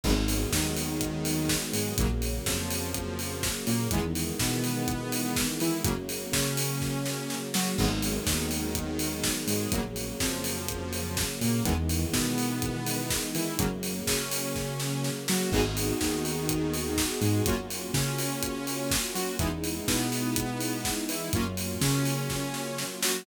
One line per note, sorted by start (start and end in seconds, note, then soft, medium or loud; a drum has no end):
0.03 0.46 G#1 medium
0.03 1.95 D#3 medium
0.03 0.12 D#3 medium
0.03 1.95 F#3 medium
0.03 0.12 F#3 medium
0.03 1.95 G#3 medium
0.03 0.12 G#3 medium
0.03 1.95 B3 medium
0.03 0.12 B3 medium
0.03 kick loud
0.03 crash loud
0.28 open hi-hat loud
0.52 1.55 D#2 medium
0.52 1.56 D#3 medium
0.52 kick loud
0.52 snare loud
0.77 open hi-hat medium
1.01 kick loud
1.01 closed hi-hat loud
1.25 open hi-hat loud
1.49 kick medium
1.49 snare loud
1.73 1.94 G#2 medium
1.73 1.94 G#3 medium
1.73 open hi-hat loud
1.97 2.40 A#1 medium
1.97 3.89 C#3 medium
1.97 2.07 C#3 medium
1.97 3.89 F#3 medium
1.97 2.07 F#3 medium
1.97 3.89 A#3 medium
1.97 2.07 A#3 medium
1.97 kick loud
1.97 closed hi-hat loud
2.22 open hi-hat medium
2.46 3.49 F2 medium
2.46 3.49 F3 medium
2.46 kick loud
2.46 snare loud
2.70 open hi-hat loud
2.94 kick loud
2.94 closed hi-hat loud
3.19 open hi-hat medium
3.43 kick loud
3.43 snare loud
3.67 3.88 A#2 medium
3.67 3.88 A#3 medium
3.67 open hi-hat medium
3.91 4.32 E2 medium
3.91 5.83 D#3 medium
3.91 4.00 D#3 medium
3.91 5.83 E3 medium
3.91 4.00 E3 medium
3.91 5.83 G#3 medium
3.91 4.00 G#3 medium
3.91 5.83 B3 medium
3.91 4.00 B3 medium
3.91 kick loud
3.91 closed hi-hat loud
4.15 open hi-hat medium
4.39 5.43 B2 medium
4.39 5.43 B3 medium
4.39 kick loud
4.39 snare loud
4.64 open hi-hat medium
4.88 kick loud
4.88 closed hi-hat loud
5.12 open hi-hat loud
5.36 kick loud
5.36 snare loud
5.60 5.82 E3 medium
5.60 5.81 E4 medium
5.60 open hi-hat medium
5.84 6.26 F#2 medium
5.84 5.92 C#3 medium
5.84 7.76 C#3 medium
5.84 5.92 F#3 medium
5.84 7.76 F#3 medium
5.84 5.92 A#3 medium
5.84 7.76 A#3 medium
5.84 kick loud
5.84 closed hi-hat loud
6.09 open hi-hat medium
6.32 7.35 C#3 medium
6.32 7.37 C#4 medium
6.32 kick loud
6.32 snare loud
6.57 open hi-hat loud
6.81 kick medium
6.81 snare medium
7.06 snare loud
7.30 snare medium
7.54 7.75 F#3 medium
7.54 7.74 F#4 medium
7.54 snare loud
7.78 8.19 G#1 medium
7.78 7.87 D#3 medium
7.78 9.71 D#3 medium
7.78 7.87 F#3 medium
7.78 9.71 F#3 medium
7.78 7.87 G#3 medium
7.78 9.71 G#3 medium
7.78 7.87 B3 medium
7.78 9.71 B3 medium
7.78 kick loud
7.78 crash loud
8.02 open hi-hat loud
8.27 9.30 D#2 medium
8.27 9.30 D#3 medium
8.27 kick loud
8.27 snare loud
8.51 open hi-hat medium
8.75 kick loud
8.75 closed hi-hat loud
8.99 open hi-hat loud
9.23 kick medium
9.23 snare loud
9.47 9.67 G#2 medium
9.47 9.70 G#3 medium
9.47 open hi-hat loud
9.72 10.13 A#1 medium
9.72 11.64 C#3 medium
9.72 9.81 C#3 medium
9.72 11.64 F#3 medium
9.72 9.81 F#3 medium
9.72 11.64 A#3 medium
9.72 9.81 A#3 medium
9.72 kick loud
9.72 closed hi-hat loud
9.96 open hi-hat medium
10.20 11.23 F2 medium
10.20 11.23 F3 medium
10.20 kick loud
10.20 snare loud
10.44 open hi-hat loud
10.68 kick loud
10.68 closed hi-hat loud
10.93 open hi-hat medium
11.17 kick loud
11.17 snare loud
11.41 11.62 A#2 medium
11.41 11.63 A#3 medium
11.41 open hi-hat medium
11.65 12.06 E2 medium
11.65 11.73 D#3 medium
11.65 13.58 D#3 medium
11.65 11.73 E3 medium
11.65 13.58 E3 medium
11.65 11.73 G#3 medium
11.65 13.58 G#3 medium
11.65 11.73 B3 medium
11.65 13.58 B3 medium
11.65 kick loud
11.65 closed hi-hat loud
11.89 open hi-hat medium
12.13 13.16 B2 medium
12.13 13.16 B3 medium
12.13 kick loud
12.13 snare loud
12.38 open hi-hat medium
12.62 kick loud
12.62 closed hi-hat loud
12.86 open hi-hat loud
13.10 kick loud
13.10 snare loud
13.34 13.56 E3 medium
13.34 13.55 E4 medium
13.34 open hi-hat medium
13.58 14.00 F#2 medium
13.58 13.66 C#3 medium
13.58 15.50 C#3 medium
13.58 13.66 F#3 medium
13.58 15.50 F#3 medium
13.58 13.66 A#3 medium
13.58 15.50 A#3 medium
13.58 kick loud
13.58 closed hi-hat loud
13.83 open hi-hat medium
14.07 15.10 C#3 medium
14.07 15.11 C#4 medium
14.07 kick loud
14.07 snare loud
14.31 open hi-hat loud
14.56 kick medium
14.56 snare medium
14.80 snare loud
15.04 snare medium
15.28 15.50 F#3 medium
15.28 15.50 F#4 medium
15.28 snare loud
15.52 15.93 G#1 medium
15.52 15.61 B3 medium
15.52 17.44 B3 medium
15.52 15.61 D#4 medium
15.52 17.44 D#4 medium
15.52 15.61 F#4 medium
15.52 17.44 F#4 medium
15.52 15.61 G#4 medium
15.52 17.44 G#4 medium
15.52 kick loud
15.52 crash loud
15.77 open hi-hat loud
16.00 17.04 D#2 medium
16.00 17.03 D#3 medium
16.00 kick medium
16.00 snare loud
16.25 open hi-hat medium
16.49 kick loud
16.49 closed hi-hat loud
16.73 open hi-hat medium
16.97 kick medium
16.97 snare loud
17.21 17.42 G#2 medium
17.21 17.42 G#3 medium
17.21 open hi-hat medium
17.46 17.88 F#2 medium
17.46 19.37 A#3 medium
17.46 17.55 A#3 medium
17.46 19.37 C#4 medium
17.46 17.55 C#4 medium
17.46 19.37 F4 medium
17.46 17.55 F4 medium
17.46 19.37 F#4 medium
17.46 17.55 F#4 medium
17.46 kick loud
17.46 closed hi-hat loud
17.70 open hi-hat medium
17.94 18.97 C#3 medium
17.94 18.98 C#4 medium
17.94 kick loud
17.94 snare loud
18.18 open hi-hat loud
18.43 kick medium
18.43 closed hi-hat loud
18.67 open hi-hat medium
18.91 kick loud
18.91 snare loud
19.14 19.36 F#3 medium
19.14 19.35 F#4 medium
19.14 open hi-hat medium
19.39 19.81 E2 medium
19.39 21.31 G#3 medium
19.39 19.48 G#3 medium
19.39 21.31 B3 medium
19.39 19.48 B3 medium
19.39 21.31 D#4 medium
19.39 19.48 D#4 medium
19.39 21.31 E4 medium
19.39 19.48 E4 medium
19.39 kick loud
19.39 closed hi-hat loud
19.64 open hi-hat medium
19.88 20.91 B2 medium
19.88 20.90 B3 medium
19.88 kick loud
19.88 snare loud
20.12 open hi-hat medium
20.36 kick loud
20.36 closed hi-hat loud
20.60 open hi-hat medium
20.85 kick medium
20.85 snare loud
21.09 21.30 E3 medium
21.09 21.30 E4 medium
21.09 open hi-hat loud
21.33 21.74 F#2 medium
21.33 23.24 F#3 medium
21.33 21.43 F#3 medium
21.33 23.24 A#3 medium
21.33 21.43 A#3 medium
21.33 23.24 C#4 medium
21.33 21.43 C#4 medium
21.33 23.24 F4 medium
21.33 21.43 F4 medium
21.33 kick loud
21.33 closed hi-hat loud
21.57 open hi-hat medium
21.81 22.84 C#3 medium
21.81 22.84 C#4 medium
21.81 kick medium
21.81 snare loud
22.05 open hi-hat medium
22.30 kick medium
22.30 snare loud
22.54 snare medium
22.78 snare loud
23.02 23.23 F#3 medium
23.02 23.23 F#4 medium
23.02 snare loud